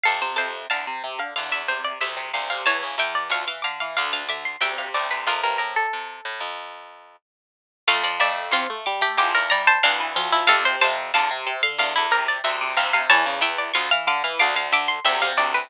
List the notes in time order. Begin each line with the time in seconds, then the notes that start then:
0.03 F2 C3 A4 F5
0.21 C3 C5
0.36 F2 C3 C5 A5
0.70 E2 D3 F5 A5
0.87 C3
1.04 C3
1.19 D3 F5
1.36 E2 D3 F5
1.51 E2 E5
1.68 C3 C5
1.84 D5
2.00 D2 C3 E5
2.17 C3
2.33 D2 C3 F5
2.50 C3 F5
2.66 E2 E3 C#5 A5
2.83 C#3
2.98 E2 E3 E5 G5
3.15 D5
3.29 D2 F3 F5 C#6
3.47 E3 F5
3.62 D3 F5 D6
3.80 E3 F5
3.97 D2 D3 F5 D6
4.13 D2 F5
4.29 D3 E5 D6
4.45 C6
4.60 D2 C3 E5 G5
4.78 C3 F5
4.94 D2 C3 D5
5.11 C3 B4
5.27 F2 C3 F4 A#4
5.43 G2 A#4
5.58 A2 A#4
5.76 A4
5.93 C3
6.25 A2
6.40 F2
7.87 F2 A3 F5
8.03 F3 D5
8.20 F2 A3 D5 E5
8.51 E2 C4 F4 C6
8.70 A3
8.86 G3 D6
9.01 A3 G4
9.17 E2 F3 G4 D6
9.34 E2 A#4
9.50 G3 D5 A#5
9.67 C5 A5
9.83 D2 E3 D4 F5
10.00 E3
10.16 D2 F3 F4
10.32 F3 E4
10.47 F2 C3 A4 F5
10.65 C3 C5
10.81 F2 C3 C5 A5
11.14 E2 D3 F5 A5
11.31 C3
11.46 C3
11.63 D3 F5
11.78 E2 D3 F5
11.96 E2 E4
12.11 C3 A#4
12.28 D5
12.44 D2 C3 E5
12.61 C3
12.76 D2 C3 F5
12.93 C3 F5
13.10 E2 E3 C#5 A5
13.26 C#3
13.41 E2 E3 E5 G5
13.58 D5
13.74 D2 F3 F5 C#6
13.91 E3 F5
14.07 D3 F5 D6
14.24 E3 F5
14.39 D2 D3 F5 D6
14.55 D2 F5
14.72 D3 E5 D6
14.88 C6
15.04 D2 C3 E5 G5
15.22 C3 F5
15.37 D2 C3 D5
15.54 C3 B4